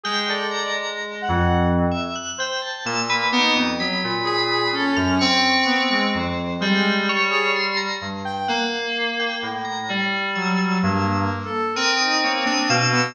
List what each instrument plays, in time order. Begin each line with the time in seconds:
0.04 electric piano 2 G#3, brass section G#4, tubular bells G5
0.28 tubular bells A4, brass section D5
0.51 tubular bells A#5
0.66 electric piano 2 G#3
1.22 brass section F#5
1.29 electric piano 2 F2
1.91 tubular bells E5
2.16 tubular bells F#6
2.38 brass section C5, tubular bells G5
2.62 tubular bells A5
2.85 electric piano 2 A#2, brass section A#3, tubular bells E6
3.10 tubular bells B4
3.32 electric piano 2 B3, brass section D#4, tubular bells D6
3.55 electric piano 2 F2, tubular bells D#6
3.79 electric piano 2 F#3, tubular bells B5
4.04 electric piano 2 A#2
4.25 brass section G#4, tubular bells B5
4.73 brass section C#4, tubular bells A4
4.96 electric piano 2 F#2, tubular bells F6
5.19 electric piano 2 C4, tubular bells C#6
5.66 brass section B3
5.90 brass section G#3
6.14 electric piano 2 F2, tubular bells C5
6.61 electric piano 2 G3, brass section G#3, tubular bells G5
7.09 tubular bells C#5
7.30 brass section G#4
7.56 tubular bells C6
7.77 tubular bells A#5
8.01 electric piano 2 G2
8.25 brass section G5
8.48 electric piano 2 A#3, tubular bells F#5
9.20 tubular bells G5
9.42 electric piano 2 A2
9.65 tubular bells A#5
9.89 electric piano 2 G3
10.35 brass section F#3, tubular bells E6
10.83 electric piano 2 G2, brass section A#3
11.14 brass section A#3
11.45 brass section A4
11.75 electric piano 2 C4, brass section A#4, tubular bells D#6
12.00 brass section D#4
12.24 brass section A#3, tubular bells C#5
12.46 brass section D4, tubular bells D#6
12.69 electric piano 2 B2, brass section F5, tubular bells E6
12.93 brass section B3